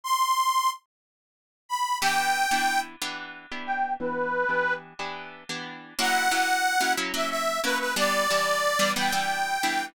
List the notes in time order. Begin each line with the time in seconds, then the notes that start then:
0.04 C6
1.69 B5
2.01 E3 B3 D4 G4 G5
2.51 E3 B3 D4 G4
3.02 E3 B3 D4 G4
3.52 E3 B3 D4 G4
3.67 G5
4.00 E3 B3 D4 G4 B4
4.49 E3 B3 D4 G4
4.99 E3 B3 D4 G4
5.49 E3 B3 D4 G4
5.99 F#3 A#3 C#4 E4 F#5
6.31 F#3 A#3 C#4 E4
6.81 F#3 A#3 C#4 E4
6.97 F#3 A#3 C#4 E4
7.14 F#3 A#3 C#4 E4 E5
7.30 E5
7.64 F#3 A#3 C#4 E4 B4
7.80 B4
7.96 E3 G3 B3 D4 D5
8.30 E3 G3 B3 D4
8.79 E3 G3 B3 D4
8.96 E3 G3 B3 D4 G5
9.12 E3 G3 B3 D4
9.63 E3 G3 B3 D4